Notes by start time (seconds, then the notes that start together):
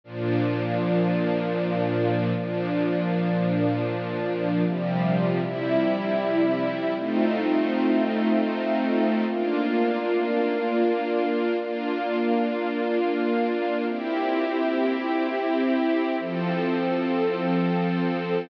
0.04 A#2 F3 D4
2.35 A#2 F3 D4
4.65 C3 F3 G3
5.42 C3 G3 E4
6.96 A3 C4 D#4 F4
9.27 A#3 D4 F4
11.57 A#3 D4 F4
13.88 C4 E4 G4
16.19 F3 C4 A4